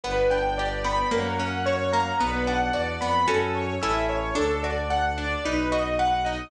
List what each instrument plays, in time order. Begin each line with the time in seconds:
0.03 violin G1, orchestral harp B3, string ensemble 1 B4 D5 G5, acoustic grand piano B4
0.30 orchestral harp D4, acoustic grand piano G5
0.58 orchestral harp G4, acoustic grand piano D5
0.84 orchestral harp B3, acoustic grand piano B5
1.11 violin F#2, orchestral harp A#3, acoustic grand piano A#4, string ensemble 1 A#4 C#5 F#5
1.39 orchestral harp C#4, acoustic grand piano F#5
1.66 orchestral harp F#4, acoustic grand piano C#5
1.93 orchestral harp A#3, acoustic grand piano A#5
2.19 violin B1, orchestral harp B3, string ensemble 1 B4 D5 F#5, acoustic grand piano B4
2.47 orchestral harp D4, acoustic grand piano F#5
2.73 violin E2, orchestral harp F#4, acoustic grand piano D5
3.01 violin F2, orchestral harp B3, acoustic grand piano B5
3.28 violin F#2, orchestral harp C#4 F#4 A4, acoustic grand piano A4
3.55 acoustic grand piano C#5
3.82 violin A1, orchestral harp C#4 E4 A4, acoustic grand piano E5
4.09 acoustic grand piano C#5
4.35 violin D2, orchestral harp D4, acoustic grand piano A4
4.63 orchestral harp F#4, acoustic grand piano D5
4.90 orchestral harp A4, acoustic grand piano F#5
5.18 orchestral harp D4, acoustic grand piano D5
5.44 violin B1, orchestral harp D#4, acoustic grand piano B4
5.72 orchestral harp F#4, acoustic grand piano D#5
5.99 orchestral harp B4, acoustic grand piano F#5
6.25 orchestral harp D#4, acoustic grand piano D#5